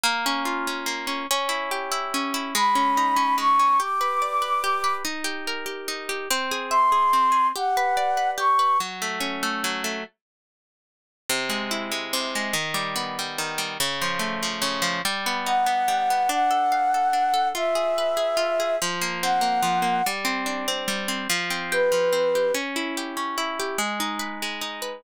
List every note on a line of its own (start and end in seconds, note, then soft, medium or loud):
0.03 0.86 A#3 loud
0.26 0.67 C#4 medium
0.45 1.24 F4 medium
0.67 1.07 C#4 medium
0.86 1.26 A#3 medium
1.07 1.27 C#4 medium
1.31 2.13 C#4 medium
1.49 1.91 E4 medium
1.71 2.50 G4 medium
1.92 2.34 E4 medium
2.14 2.54 C#4 medium
2.34 2.54 E4 medium
2.55 3.37 G#3 loud
2.55 3.36 B5 medium
2.75 3.16 C#4 medium
2.97 3.76 D#4 medium
3.16 3.59 C#4 medium
3.38 3.77 G#3 medium
3.38 3.78 C#6 medium
3.59 3.79 C#4 medium
3.80 4.63 G4 medium
3.80 4.94 D6 medium
4.01 4.41 B4 medium
4.22 5.01 D5 medium
4.42 4.83 B4 medium
4.64 5.03 G4 medium
4.84 5.04 B4 medium
5.05 5.88 D#4 medium
5.24 5.65 G4 medium
5.47 6.26 A#4 medium
5.66 6.09 G4 medium
5.88 6.28 D#4 medium
6.09 6.29 G4 medium
6.30 7.13 C4 medium
6.51 6.92 G#4 medium
6.70 7.50 E5 medium
6.70 7.47 C6 medium
6.92 7.31 G#4 medium
7.13 7.53 C4 medium
7.32 7.52 G#4 medium
7.55 8.37 G4 medium
7.55 8.30 F#5 soft
7.77 8.17 B4 medium
7.97 8.76 D5 medium
8.17 8.59 B4 medium
8.38 8.77 G4 medium
8.38 8.78 C#6 soft
8.59 8.79 B4 medium
8.80 9.63 F#3 medium
9.02 9.42 A3 medium
9.20 10.00 C#4 medium
9.43 9.84 A3 medium
9.64 10.03 F#3 medium
9.84 10.04 A3 medium
11.29 12.13 C3 medium
11.50 11.91 G#3 medium
11.71 12.50 E4 medium
11.91 12.35 G#3 medium
12.13 12.53 C3 medium
12.35 12.55 G#3 medium
12.53 13.38 D#3 medium
12.74 13.18 G3 medium
12.96 13.75 B3 medium
13.19 13.58 G3 medium
13.38 13.78 D#3 medium
13.58 13.78 G3 medium
13.80 14.61 C#3 medium
14.01 14.42 F3 medium
14.19 14.99 A3 medium
14.43 14.81 F3 medium
14.62 15.01 C#3 medium
14.82 15.02 F3 medium
15.05 15.88 G3 medium
15.26 15.66 B3 medium
15.46 16.26 D#4 medium
15.46 16.29 F#5 medium
15.66 16.10 B3 medium
15.88 16.28 G3 medium
16.10 16.30 B3 medium
16.29 17.13 D4 medium
16.29 17.48 F#5 medium
16.51 16.94 A4 medium
16.72 17.51 F5 medium
16.94 17.33 A4 medium
17.13 17.53 D4 medium
17.34 17.53 A4 medium
17.54 18.36 F4 medium
17.54 18.76 E5 medium
17.75 18.16 G#4 medium
17.98 18.77 B4 medium
18.17 18.59 G#4 medium
18.37 18.76 F4 medium
18.60 18.80 G#4 medium
18.82 19.62 F3 medium
19.01 19.41 A#3 medium
19.22 20.02 C4 medium
19.22 20.05 F#5 soft
19.41 19.82 A#3 medium
19.63 20.02 F3 medium
19.82 20.02 A#3 medium
20.06 20.87 G3 medium
20.25 20.67 C4 medium
20.46 21.25 D4 medium
20.68 21.08 C4 medium
20.88 21.27 G3 medium
21.08 21.28 C4 medium
21.30 21.91 F3 medium
21.50 22.12 C4 medium
21.72 22.35 G4 medium
21.72 22.51 B4 medium
21.92 22.51 F3 medium
22.13 22.52 C4 medium
22.35 22.55 G4 medium
22.54 23.16 C#4 medium
22.76 23.37 E4 medium
22.97 23.59 G4 medium
23.17 23.76 C#4 medium
23.38 23.77 E4 medium
23.60 23.79 G4 medium
23.78 24.42 G#3 medium
24.00 24.61 D#4 medium
24.19 24.82 B4 medium
24.42 25.02 G#3 medium
24.61 25.01 D#4 medium
24.82 25.02 B4 medium